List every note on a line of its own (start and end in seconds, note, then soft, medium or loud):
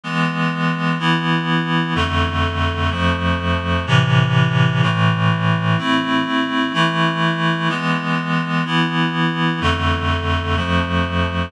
0.03 0.98 E3 medium
0.03 0.98 G#3 medium
0.03 0.98 B3 medium
0.99 1.94 E3 medium
0.99 1.94 B3 medium
0.99 1.94 E4 medium
1.95 2.90 F2 medium
1.95 2.90 D3 medium
1.95 2.90 A3 medium
2.91 3.85 F2 medium
2.91 3.85 F3 medium
2.91 3.85 A3 medium
3.87 4.81 A2 medium
3.87 4.81 C3 medium
3.87 4.81 E3 medium
4.82 5.77 A2 medium
4.82 5.77 E3 medium
4.82 5.77 A3 medium
5.78 6.73 A3 medium
5.78 6.73 C4 medium
5.78 6.73 E4 medium
6.73 7.68 E3 medium
6.73 7.68 A3 medium
6.73 7.68 E4 medium
7.69 8.64 E3 medium
7.69 8.64 G#3 medium
7.69 8.64 B3 medium
8.65 9.60 E3 medium
8.65 9.60 B3 medium
8.65 9.60 E4 medium
9.61 10.56 F2 medium
9.61 10.56 D3 medium
9.61 10.56 A3 medium
10.56 11.51 F2 medium
10.56 11.51 F3 medium
10.56 11.51 A3 medium